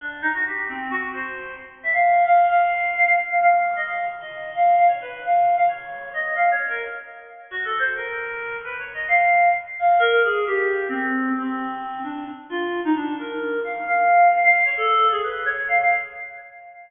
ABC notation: X:1
M:5/8
L:1/16
Q:1/4=132
K:none
V:1 name="Clarinet"
D2 ^D ^F G2 C2 F2 | c4 z2 e f3 | f2 f4 f f z f | f3 ^d f2 z d3 |
f2 f ^c B2 f3 f | ^c4 ^d2 (3f2 c2 ^A2 | z6 (3^F2 A2 c2 | ^A6 (3B2 ^c2 ^d2 |
f4 z2 f2 ^A2 | ^G2 =G4 C4 | C6 D2 z2 | F3 ^D =D2 ^A4 |
f2 f4 f f2 ^c | A3 ^G B2 ^c2 f f |]